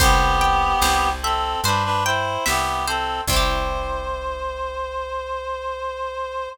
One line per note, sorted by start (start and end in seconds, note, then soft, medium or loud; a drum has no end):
0.00 0.74 C2 loud
0.00 1.09 B3 loud
0.00 1.09 G4 loud
0.00 0.82 C5 loud
0.00 kick loud
0.00 crash loud
0.41 2.05 G5 loud
0.82 1.56 C2 loud
0.82 1.65 C5 medium
0.82 snare loud
1.22 1.61 C4 medium
1.22 1.61 A4 loud
1.22 2.45 E5 medium
1.64 2.38 G2 medium
1.64 1.84 D4 medium
1.64 1.84 B4 loud
1.64 2.87 C5 loud
1.64 closed hi-hat loud
1.84 2.04 D4 loud
1.84 2.04 B4 loud
2.04 2.44 E4 medium
2.04 2.44 C5 loud
2.04 3.23 G5 loud
2.46 3.21 C2 medium
2.46 2.85 B3 medium
2.46 2.85 G4 loud
2.46 3.24 E5 loud
2.46 snare loud
2.87 3.21 C4 medium
2.87 3.21 A4 medium
2.87 3.27 C5 loud
3.27 6.48 C2 loud
3.27 6.50 C4 loud
3.27 6.49 C5 loud
3.27 kick loud
3.27 crash loud
3.33 6.50 E4 medium
3.33 6.50 G4 medium